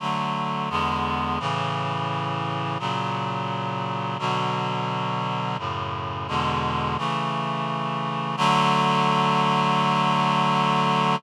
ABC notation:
X:1
M:4/4
L:1/8
Q:1/4=86
K:D
V:1 name="Clarinet"
[D,F,A,]2 [E,,D,^G,B,]2 [A,,C,E,]4 | [^A,,C,F,]4 [B,,D,F,]4 | [F,,A,,C,]2 [E,,B,,D,^G,]2 [C,E,A,]4 | [D,F,A,]8 |]